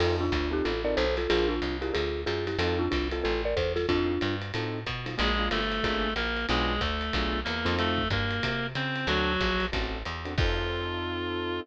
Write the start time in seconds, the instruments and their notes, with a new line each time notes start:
0.00 electric bass (finger) F2, acoustic grand piano C4 D#4 F4 A4, marimba F4 A4, crash, ride
0.21 marimba D4 F4
0.32 electric bass (finger) D2, marimba D4 F4, kick, hi-hat pedal, ride
0.51 acoustic grand piano C4 D#4 F4 A4, marimba D#4 G4
0.65 electric bass (finger) A1, marimba F4 A4, ride
0.84 acoustic grand piano C4 D#4 F4 A4, marimba A#4 D5
0.97 electric bass (finger) B1, marimba A4 C5, hi-hat pedal, ride
1.17 marimba F4 A4, snare, ride
1.30 electric bass (finger) A#1, acoustic grand piano D4 F4 G#4 A#4, marimba F4 G#4, ride
1.49 marimba D4 F4
1.62 electric bass (finger) C2, hi-hat pedal, ride
1.81 acoustic grand piano D4 F4 G#4 A#4, marimba E4 G4, ride
1.94 electric bass (finger) D2, marimba F4 G#4, ride
2.26 electric bass (finger) F#2, marimba F4 G#4, hi-hat pedal, ride
2.47 marimba E4 G4, snare, ride
2.59 electric bass (finger) F2, acoustic grand piano C4 D#4 F4 A4, marimba F4 A4, ride
2.79 marimba D4 F4
2.91 electric bass (finger) C2, marimba D4 F4, kick, hi-hat pedal, ride
3.11 acoustic grand piano C4 D#4 F4 A4, marimba F4 A4, ride
3.24 electric bass (finger) A1, marimba F4 A4
3.45 marimba A#4 D5
3.56 electric bass (finger) E2, marimba A4 C5, kick, hi-hat pedal, ride
3.76 marimba F4 A4, snare, ride
3.89 electric bass (finger) F2, acoustic grand piano C4 D#4 F4 A4, marimba D4 F4, kick, ride
4.21 electric bass (finger) G2, hi-hat pedal, ride
4.42 ride
4.54 electric bass (finger) A2, acoustic grand piano C4 D#4 F4 A4, ride
4.86 electric bass (finger) B2, kick, hi-hat pedal, ride
5.06 acoustic grand piano C4 D#4 F4 A4, snare, ride
5.18 electric bass (finger) A#1, clarinet G#3 G#4, acoustic grand piano A#3 D4 F4 G#4, ride
5.39 acoustic grand piano A#3 D4 F4 G#4
5.51 electric bass (finger) G1, clarinet A3 A4, hi-hat pedal, ride
5.72 ride
5.83 electric bass (finger) G#1, acoustic grand piano A#3 D4 F4 G#4, kick, ride
6.16 electric bass (finger) A#1, clarinet A#3 A#4, hi-hat pedal, ride
6.37 ride
6.49 electric bass (finger) B1, clarinet G#3 G#4, acoustic grand piano B3 D4 F4 G#4, ride
6.81 electric bass (finger) D2, clarinet A3 A4, kick, hi-hat pedal, ride
7.01 ride
7.13 electric bass (finger) B1, acoustic grand piano B3 D4 F4 G#4, kick, ride
7.44 electric bass (finger) E2, clarinet A#3 A#4, hi-hat pedal, ride
7.65 electric bass (finger) F2, acoustic grand piano C4 D#4 F4 A4, ride
7.79 clarinet A3 A4, ride
7.98 kick
8.10 electric bass (finger) G2, clarinet A#3 A#4, kick, hi-hat pedal, ride
8.31 ride
8.43 electric bass (finger) C3, kick, ride
8.75 electric bass (finger) C#3, clarinet C4 C5, hi-hat pedal, ride
8.96 ride
9.07 electric bass (finger) D2, clarinet F#3 F#4, acoustic grand piano C4 D4 F#4 A4, ride
9.41 electric bass (finger) A#1, kick, hi-hat pedal, ride
9.60 ride
9.72 electric bass (finger) A1, acoustic grand piano C4 D4 F#4 A4, kick, ride
10.05 electric bass (finger) E2, hi-hat pedal, ride
10.25 acoustic grand piano C4 D4 F#4 A4, ride
10.38 electric bass (finger) F2, acoustic grand piano C4 D#4 F4 A4, clarinet F4, kick, crash